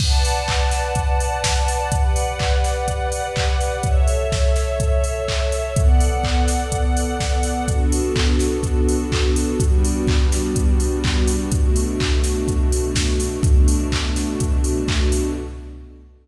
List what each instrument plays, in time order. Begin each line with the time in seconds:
0.00 string ensemble 1 B4 D5 F#5 A5, kick, crash
0.25 open hi-hat
0.48 kick, clap
0.71 snare, open hi-hat
0.95 kick, closed hi-hat
1.20 open hi-hat
1.44 kick, snare
1.68 open hi-hat
1.92 string ensemble 1 G4 B4 D5 F#5, kick, closed hi-hat
2.16 open hi-hat
2.39 kick, clap
2.64 snare, open hi-hat
2.88 kick, closed hi-hat
3.12 open hi-hat
3.36 kick, clap
3.60 open hi-hat
3.83 string ensemble 1 A4 C#5 E5, kick, closed hi-hat
4.08 open hi-hat
4.32 kick, snare
4.56 snare, open hi-hat
4.80 kick, closed hi-hat
5.04 open hi-hat
5.28 kick, clap
5.52 open hi-hat
5.76 string ensemble 1 B3 A4 D5 F#5, kick, closed hi-hat
6.00 open hi-hat
6.24 kick, clap
6.48 snare, open hi-hat
6.72 kick, closed hi-hat
6.97 open hi-hat
7.20 kick, snare
7.43 open hi-hat
7.68 string ensemble 1 B3 D4 F#4 A4, kick, closed hi-hat
7.92 open hi-hat
8.16 kick, clap
8.39 snare, open hi-hat
8.63 kick, closed hi-hat
8.88 open hi-hat
9.12 kick, clap
9.36 open hi-hat
9.60 string ensemble 1 G3 B3 D4 F#4, kick, closed hi-hat
9.85 open hi-hat
10.07 kick, clap
10.32 snare, open hi-hat
10.56 kick, closed hi-hat
10.80 open hi-hat
11.04 kick, clap
11.28 open hi-hat
11.52 string ensemble 1 B2 A3 D4 F#4, kick, closed hi-hat
11.76 open hi-hat
12.00 kick, clap
12.24 snare, open hi-hat
12.48 kick, closed hi-hat
12.72 open hi-hat
12.95 kick, snare
13.20 open hi-hat
13.43 string ensemble 1 B2 A3 D4 F#4, kick, closed hi-hat
13.68 open hi-hat
13.92 kick, clap
14.16 snare, open hi-hat
14.40 kick, closed hi-hat
14.64 open hi-hat
14.88 kick, clap
15.12 open hi-hat